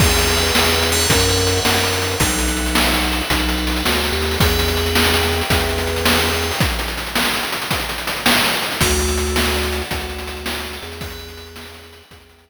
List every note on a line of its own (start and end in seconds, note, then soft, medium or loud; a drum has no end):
0.00 0.51 E2 medium
0.00 0.87 B4 medium
0.00 0.87 E5 medium
0.00 0.87 G5 medium
0.00 kick loud
0.00 crash loud
0.09 closed hi-hat medium
0.18 closed hi-hat medium
0.27 closed hi-hat medium
0.37 closed hi-hat medium
0.46 closed hi-hat medium
0.55 1.06 E2 medium
0.55 snare loud
0.64 closed hi-hat medium
0.73 closed hi-hat medium
0.82 closed hi-hat medium
0.92 2.18 B4 medium
0.92 2.18 C#5 medium
0.92 2.18 E5 medium
0.92 2.18 F#5 medium
0.92 closed hi-hat medium
1.01 closed hi-hat medium
1.09 1.60 F#2 medium
1.09 kick loud
1.09 closed hi-hat loud
1.19 closed hi-hat medium
1.29 closed hi-hat medium
1.38 closed hi-hat medium
1.47 closed hi-hat medium
1.56 closed hi-hat medium
1.65 2.16 F#2 medium
1.65 snare loud
1.74 closed hi-hat medium
1.84 closed hi-hat medium
1.93 closed hi-hat medium
2.02 closed hi-hat medium
2.11 closed hi-hat medium
2.20 3.22 B1 medium
2.20 4.35 A4 medium
2.20 4.35 B4 medium
2.20 4.35 E5 medium
2.20 4.35 F#5 medium
2.20 kick loud
2.20 closed hi-hat loud
2.29 closed hi-hat medium
2.39 closed hi-hat medium
2.48 closed hi-hat medium
2.57 closed hi-hat medium
2.66 closed hi-hat medium
2.75 snare loud
2.84 closed hi-hat medium
2.94 closed hi-hat medium
3.03 closed hi-hat medium
3.12 closed hi-hat medium
3.21 closed hi-hat medium
3.30 3.83 B1 medium
3.30 kick medium
3.30 closed hi-hat loud
3.39 closed hi-hat medium
3.49 closed hi-hat medium
3.58 closed hi-hat medium
3.67 closed hi-hat medium
3.76 closed hi-hat medium
3.85 4.11 D2 medium
3.85 snare loud
3.94 closed hi-hat medium
4.04 closed hi-hat medium
4.12 4.37 D#2 medium
4.12 closed hi-hat medium
4.22 closed hi-hat medium
4.31 open hi-hat medium
4.40 5.42 E2 medium
4.40 6.57 B4 medium
4.40 6.57 E5 medium
4.40 6.57 G5 medium
4.40 kick loud
4.40 closed hi-hat loud
4.49 closed hi-hat medium
4.59 closed hi-hat medium
4.68 closed hi-hat medium
4.77 closed hi-hat medium
4.86 closed hi-hat medium
4.95 snare loud
5.05 closed hi-hat medium
5.14 closed hi-hat medium
5.23 closed hi-hat medium
5.32 closed hi-hat medium
5.41 closed hi-hat medium
5.50 6.51 E2 medium
5.50 kick loud
5.50 closed hi-hat loud
5.60 closed hi-hat medium
5.69 closed hi-hat medium
5.78 closed hi-hat medium
5.87 closed hi-hat medium
5.96 closed hi-hat medium
6.05 snare loud
6.15 closed hi-hat medium
6.24 closed hi-hat medium
6.33 closed hi-hat medium
6.42 closed hi-hat medium
6.51 open hi-hat medium
6.60 kick loud
6.60 closed hi-hat loud
6.70 closed hi-hat medium
6.79 closed hi-hat medium
6.88 closed hi-hat medium
6.97 closed hi-hat medium
7.06 closed hi-hat medium
7.15 snare loud
7.25 closed hi-hat medium
7.34 closed hi-hat medium
7.43 closed hi-hat medium
7.52 closed hi-hat medium
7.62 closed hi-hat medium
7.71 kick medium
7.71 closed hi-hat loud
7.80 closed hi-hat medium
7.89 closed hi-hat medium
7.98 closed hi-hat medium
8.07 closed hi-hat medium
8.17 closed hi-hat medium
8.26 snare loud
8.35 closed hi-hat medium
8.44 closed hi-hat medium
8.53 closed hi-hat medium
8.62 closed hi-hat medium
8.72 closed hi-hat medium
8.81 9.82 D2 loud
8.81 10.97 A4 medium
8.81 10.97 D5 medium
8.81 10.97 F#5 medium
8.81 kick loud
8.81 closed hi-hat loud
8.90 closed hi-hat medium
8.99 closed hi-hat medium
9.08 closed hi-hat medium
9.18 closed hi-hat medium
9.27 closed hi-hat medium
9.36 snare loud
9.45 closed hi-hat medium
9.54 closed hi-hat medium
9.63 closed hi-hat medium
9.72 closed hi-hat medium
9.82 closed hi-hat medium
9.91 10.78 D2 medium
9.91 kick medium
9.91 closed hi-hat loud
10.00 closed hi-hat medium
10.09 closed hi-hat medium
10.19 closed hi-hat medium
10.27 closed hi-hat medium
10.37 closed hi-hat medium
10.46 snare loud
10.55 closed hi-hat medium
10.64 closed hi-hat medium
10.73 closed hi-hat medium
10.83 12.02 E2 medium
10.83 closed hi-hat medium
10.92 closed hi-hat medium
11.01 12.50 B4 medium
11.01 12.50 E5 medium
11.01 12.50 G5 medium
11.01 kick loud
11.01 closed hi-hat loud
11.10 closed hi-hat medium
11.19 closed hi-hat medium
11.28 closed hi-hat medium
11.37 closed hi-hat medium
11.47 closed hi-hat medium
11.56 snare loud
11.65 closed hi-hat medium
11.74 closed hi-hat medium
11.83 closed hi-hat medium
11.93 closed hi-hat medium
12.02 closed hi-hat medium
12.11 12.50 E2 medium
12.11 kick medium
12.11 closed hi-hat loud
12.20 closed hi-hat medium
12.29 closed hi-hat medium
12.38 closed hi-hat medium
12.48 closed hi-hat medium